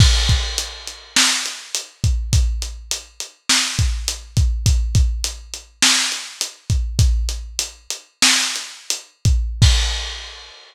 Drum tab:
CC |x-------|--------|--------|--------|
HH |-xxx-xxx|xxxx-xxx|xxxx-xxx|xxxx-xxx|
SD |----o---|----o---|----o---|----o---|
BD |oo-----o|o----o-o|oo-----o|o------o|

CC |x-------|
HH |--------|
SD |--------|
BD |o-------|